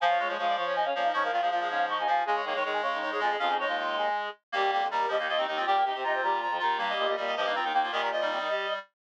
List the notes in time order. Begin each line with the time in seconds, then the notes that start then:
0.00 F3 F4 F5 G#5
0.10 C#5
0.19 G#3 C#5
0.28 F3 G#3 C#5
0.38 F3 G#3 F4 C#5 F5
0.48 D5
0.56 F3 F4 C#5 F5
0.66 C#4 C#5
0.75 D#4 D#5 G#5
0.85 C#3 C#4 C#5 F5
0.94 A#2 F3 C#4 C#5 F5
1.04 D#4 D#5
1.13 G#2 F3 C#4 C#5 C#6
1.23 A#3 A#4 F5
1.31 A#2 D#3 F3 F4 F5
1.41 A#2 F3 G#3 G#4 F5
1.50 A#2 F3 F4 F5
1.60 G#3 G#4 F5
1.69 G#2 C#4 C#5 F5
1.89 D#4 D#5 C#6
1.98 D#2 D#4 D#5 G#5
2.07 D#2 F3 F4 F5 G#5
2.25 C#3 G#3 G#4 G#5
2.36 C#5
2.44 D#3 A#3 C#5
2.55 D#3 G#3 C#5
2.64 D#3 G#3 G#4 C#5
2.73 G#5
2.82 C#3 G#3 G#4 C#5
2.93 D#3 D#4
3.01 D#3 D#4 C#5
3.11 G#2 G#3 G#4 C#5
3.19 F2 F3 G#3 F4 G#4
3.30 G#3 G#4
3.39 F2 C#4 F4 G#4 F5
3.48 D#4 D#5
3.59 G#3 D#4 C#5 D#5
3.67 D#2 F4
3.78 F4
3.97 G#4
4.52 D#2 G3 A#3 G4
4.72 F2 G4
4.82 F2
4.90 D#2 G3 G4 A#4
5.08 D#2 F3 G3 G4 D#5
5.19 D#3 A#3 D#4
5.28 F3 A#3 F4 D#5
5.37 D#2 D#3 C4 D#4
5.47 D#2 D#3 D#4 D#5
5.57 F3 C4 F4
5.66 A#2 G3 G4 G5
5.76 A#3 A#4
5.84 C3 D#4 G4 D#5 G5
5.94 C3 C4 G4 C5
6.03 C3 D#4 F4 D#5 A#5
6.14 C4 C5
6.22 A#2 G3 G4 A#5
6.41 F3 F4 A#5
6.50 F2 F3 F4
6.59 D#2 D#3 D#4 F4 A#5
6.78 G2 G3 A#3 G4 A#5
6.89 D#5
6.98 A#2 D#5
7.08 A#2 D#5
7.16 A#2 G3 G4 D#5
7.27 D#5
7.36 G2 F3 G3 G4 D#5
7.46 D#3 A#3 D#4
7.55 F3 C4 F4 A#5
7.63 D#2 D#3 D#4 G5
7.72 D#2 D#3 A#3 D#4 G5
7.82 F3 A#3 F4
7.92 A#2 D#3 G3 G4 D#5
8.01 G3 G4 A#4
8.12 F3 F4 D#5
8.21 D#3 G3 D#4
8.30 C3 C4
8.39 D#3 D#4
8.49 G3 G4